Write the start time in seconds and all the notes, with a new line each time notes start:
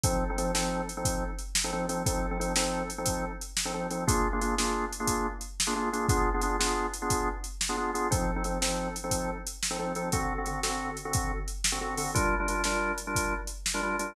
0.04 F3 C4 D#4 A4, kick, closed hi-hat
0.30 F3 C4 D#4 A4
0.38 F3 C4 D#4 A4, closed hi-hat
0.55 F3 C4 D#4 A4, snare
0.89 closed hi-hat
0.97 F3 C4 D#4 A4
1.05 kick, closed hi-hat
1.39 closed hi-hat
1.55 snare
1.64 F3 C4 D#4 A4
1.73 F3 C4 D#4 A4
1.89 F3 C4 D#4 A4, closed hi-hat
2.06 F3 C4 D#4 A4, kick, closed hi-hat
2.31 F3 C4 D#4 A4
2.40 F3 C4 D#4 A4, closed hi-hat
2.56 F3 C4 D#4 A4, snare
2.90 closed hi-hat
2.98 F3 C4 D#4 A4
3.06 kick, closed hi-hat
3.41 closed hi-hat
3.57 snare
3.65 F3 C4 D#4 A4
3.74 F3 C4 D#4 A4
3.91 F3 C4 D#4 A4, closed hi-hat
4.07 A#3 D4 F4 G#4, kick, closed hi-hat
4.33 A#3 D4 F4 G#4
4.41 A#3 D4 F4 G#4, closed hi-hat
4.58 A#3 D4 F4 G#4, snare
4.93 closed hi-hat
5.00 A#3 D4 F4 G#4
5.07 kick, closed hi-hat
5.41 closed hi-hat
5.60 snare
5.67 A#3 D4 F4 G#4
5.76 A#3 D4 F4 G#4
5.93 A#3 D4 F4 G#4, closed hi-hat
6.09 B3 D4 F4 G#4, kick, closed hi-hat
6.34 B3 D4 F4 G#4
6.41 B3 D4 F4 G#4, closed hi-hat
6.59 B3 D4 F4 G#4, snare
6.93 closed hi-hat
7.02 B3 D4 F4 G#4
7.10 kick, closed hi-hat
7.44 closed hi-hat
7.61 snare
7.69 B3 D4 F4 G#4
7.77 B3 D4 F4 G#4
7.94 B3 D4 F4 G#4, closed hi-hat
8.11 F3 C4 D#4 A4, kick, closed hi-hat
8.36 F3 C4 D#4 A4
8.44 F3 C4 D#4 A4, closed hi-hat
8.62 F3 C4 D#4 A4, snare
8.96 closed hi-hat
9.04 F3 C4 D#4 A4
9.11 kick, closed hi-hat
9.47 closed hi-hat
9.63 snare
9.71 F3 C4 D#4 A4
9.79 F3 C4 D#4 A4
9.95 F3 C4 D#4 A4, closed hi-hat
10.12 D3 C4 F#4 A4, kick, closed hi-hat
10.38 D3 C4 F#4 A4
10.46 D3 C4 F#4 A4, closed hi-hat
10.63 D3 C4 F#4 A4, snare
10.97 closed hi-hat
11.05 D3 C4 F#4 A4
11.13 kick, closed hi-hat
11.48 closed hi-hat
11.64 snare
11.72 D3 C4 F#4 A4
11.81 D3 C4 F#4 A4
11.97 D3 C4 F#4 A4, open hi-hat
12.14 G3 D4 F4 A#4, kick, closed hi-hat
12.40 G3 D4 F4 A#4
12.48 G3 D4 F4 A#4, closed hi-hat
12.64 G3 D4 F4 A#4, snare
12.98 closed hi-hat
13.07 G3 D4 F4 A#4
13.15 kick, closed hi-hat
13.47 closed hi-hat
13.66 snare
13.74 G3 D4 F4 A#4
13.83 G3 D4 F4 A#4
13.99 G3 D4 F4 A#4, closed hi-hat